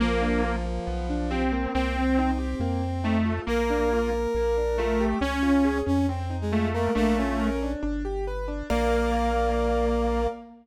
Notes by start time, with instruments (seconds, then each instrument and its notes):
0.00 synth bass 1 A#1, brass section F3, lead 2 (sawtooth) A#3, acoustic grand piano A#3
0.21 acoustic grand piano D4
0.44 acoustic grand piano F4
0.65 acoustic grand piano A#3
0.87 synth bass 1 B1, acoustic grand piano B3
1.10 acoustic grand piano D4
1.30 lead 2 (sawtooth) C4, acoustic grand piano G4
1.52 acoustic grand piano A#3
1.74 synth bass 1 C2, brass section C4, lead 2 (sawtooth) C4
1.97 acoustic grand piano C4
2.19 acoustic grand piano D#4
2.38 acoustic grand piano G4
2.60 synth bass 1 F2, acoustic grand piano A#3
2.82 acoustic grand piano C4
3.04 lead 2 (sawtooth) A3, acoustic grand piano D#4
3.25 acoustic grand piano F4
3.46 synth bass 1 A#1, lead 2 (sawtooth) A#3, acoustic grand piano A#3, brass section A#4
3.70 acoustic grand piano D4
3.93 acoustic grand piano F4
4.13 acoustic grand piano A#3
4.35 synth bass 1 A#1, acoustic grand piano A#3
4.57 acoustic grand piano D4
4.78 lead 2 (sawtooth) A3, acoustic grand piano F4
5.00 acoustic grand piano G4
5.21 synth bass 1 C#2, lead 2 (sawtooth) C#4, brass section C#4, acoustic grand piano C#4
5.43 acoustic grand piano F4
5.64 acoustic grand piano G#4
5.86 synth bass 1 F2, acoustic grand piano C#4, brass section C#4
6.09 brass section C4, acoustic grand piano C4
6.30 acoustic grand piano D#4
6.41 brass section G#3
6.52 lead 2 (sawtooth) A3, acoustic grand piano F4
6.74 brass section A#3, acoustic grand piano A#4
6.95 synth bass 1 A#1, lead 2 (sawtooth) A3, brass section A#3, acoustic grand piano D4
7.17 brass section C#4, acoustic grand piano F4
7.40 acoustic grand piano A#4
7.62 acoustic grand piano D4
7.83 synth bass 1 G1, acoustic grand piano D4
8.05 acoustic grand piano G4
8.27 acoustic grand piano B4
8.48 acoustic grand piano D4
8.70 synth bass 1 A#1, brass section A#3, lead 2 (sawtooth) A#3, acoustic grand piano A#4 D5 F5